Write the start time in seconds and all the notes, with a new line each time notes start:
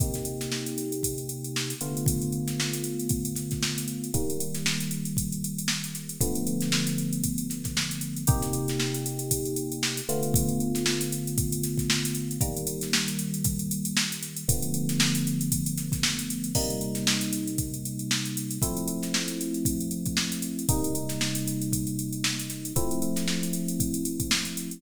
0.00 C3 A#3 D#4 G4, kick, closed hi-hat
0.14 snare, closed hi-hat
0.25 closed hi-hat
0.41 snare, closed hi-hat
0.52 snare
0.66 closed hi-hat
0.78 closed hi-hat
0.92 closed hi-hat
1.03 kick, closed hi-hat
1.18 closed hi-hat
1.29 closed hi-hat
1.44 closed hi-hat
1.56 snare
1.70 closed hi-hat
1.81 D3 A3 B3 F4, closed hi-hat
1.97 closed hi-hat
2.06 kick, closed hi-hat
2.22 closed hi-hat
2.32 closed hi-hat
2.48 snare, closed hi-hat
2.60 snare
2.72 snare, closed hi-hat
2.84 closed hi-hat
2.99 closed hi-hat
3.09 kick, closed hi-hat
3.25 closed hi-hat
3.36 snare, closed hi-hat
3.51 kick, snare, closed hi-hat
3.62 snare
3.78 closed hi-hat
3.88 closed hi-hat
4.04 closed hi-hat
4.14 D#3 G3 A#3, kick, closed hi-hat
4.30 closed hi-hat
4.40 closed hi-hat
4.55 snare, closed hi-hat
4.66 snare
4.80 closed hi-hat
4.91 closed hi-hat
5.05 closed hi-hat
5.17 kick, closed hi-hat
5.32 closed hi-hat
5.44 closed hi-hat
5.59 closed hi-hat
5.68 snare
5.84 closed hi-hat
5.95 snare, closed hi-hat
6.09 closed hi-hat
6.21 D3 F3 A3 B3, kick, closed hi-hat
6.35 closed hi-hat
6.47 closed hi-hat
6.61 snare, closed hi-hat
6.72 snare
6.87 closed hi-hat
6.98 closed hi-hat
7.13 closed hi-hat
7.24 kick, closed hi-hat
7.38 closed hi-hat
7.50 snare, closed hi-hat
7.64 kick, snare, closed hi-hat
7.77 snare
7.91 closed hi-hat
8.01 closed hi-hat
8.16 closed hi-hat
8.27 C3 A#3 D#4 G4, kick, closed hi-hat
8.42 snare, closed hi-hat
8.53 closed hi-hat
8.68 snare, closed hi-hat
8.80 snare
8.94 closed hi-hat
9.06 closed hi-hat
9.19 closed hi-hat
9.31 kick, closed hi-hat
9.45 closed hi-hat
9.56 closed hi-hat
9.72 closed hi-hat
9.83 snare
9.97 closed hi-hat
10.09 D3 A3 B3 F4, closed hi-hat
10.23 closed hi-hat
10.34 kick, closed hi-hat
10.49 closed hi-hat
10.60 closed hi-hat
10.75 snare, closed hi-hat
10.86 snare
11.01 snare, closed hi-hat
11.12 closed hi-hat
11.27 closed hi-hat
11.38 kick, closed hi-hat
11.52 closed hi-hat
11.63 snare, closed hi-hat
11.78 kick, snare, closed hi-hat
11.90 snare
12.05 closed hi-hat
12.15 closed hi-hat
12.31 closed hi-hat
12.41 D#3 G3 A#3, kick, closed hi-hat
12.57 closed hi-hat
12.67 closed hi-hat
12.81 snare, closed hi-hat
12.93 snare
13.08 closed hi-hat
13.19 closed hi-hat
13.34 closed hi-hat
13.44 kick, closed hi-hat
13.59 closed hi-hat
13.71 closed hi-hat
13.85 closed hi-hat
13.97 snare
14.12 closed hi-hat
14.23 snare, closed hi-hat
14.37 closed hi-hat
14.48 D3 F3 A3 B3, kick, closed hi-hat
14.62 closed hi-hat
14.74 closed hi-hat
14.89 snare, closed hi-hat
15.00 snare
15.15 closed hi-hat
15.27 closed hi-hat
15.41 closed hi-hat
15.52 kick, closed hi-hat
15.66 closed hi-hat
15.77 snare, closed hi-hat
15.92 kick, snare, closed hi-hat
16.03 snare
16.19 closed hi-hat
16.30 closed hi-hat
16.44 closed hi-hat
16.55 C3 G3 A#3 D#4, kick, crash
16.70 closed hi-hat
16.81 closed hi-hat
16.95 snare, closed hi-hat
17.07 snare
17.21 closed hi-hat
17.33 closed hi-hat
17.47 closed hi-hat
17.58 kick, closed hi-hat
17.74 closed hi-hat
17.85 closed hi-hat
17.99 closed hi-hat
18.11 snare
18.25 closed hi-hat
18.37 closed hi-hat
18.51 closed hi-hat
18.62 F3 A3 C4 E4, kick, closed hi-hat
18.77 closed hi-hat
18.87 closed hi-hat
19.03 snare, closed hi-hat
19.14 snare
19.28 closed hi-hat
19.41 closed hi-hat
19.54 closed hi-hat
19.65 kick, closed hi-hat
19.80 closed hi-hat
19.91 closed hi-hat
20.05 kick, closed hi-hat
20.17 snare
20.32 closed hi-hat
20.42 closed hi-hat
20.59 closed hi-hat
20.69 C3 G3 A#3 D#4, kick, closed hi-hat
20.84 closed hi-hat
20.95 closed hi-hat
21.09 snare, closed hi-hat
21.21 snare
21.35 closed hi-hat
21.48 closed hi-hat
21.62 closed hi-hat
21.73 kick, closed hi-hat
21.87 closed hi-hat
21.99 closed hi-hat
22.12 closed hi-hat
22.24 snare
22.39 closed hi-hat
22.50 snare, closed hi-hat
22.65 closed hi-hat
22.76 F3 A3 C4 E4, kick, closed hi-hat
22.91 closed hi-hat
23.02 closed hi-hat
23.16 snare, closed hi-hat
23.28 snare
23.43 closed hi-hat
23.53 closed hi-hat
23.68 closed hi-hat
23.80 kick, closed hi-hat
23.94 closed hi-hat
24.05 closed hi-hat
24.20 kick, closed hi-hat
24.31 snare
24.45 closed hi-hat
24.57 closed hi-hat
24.71 closed hi-hat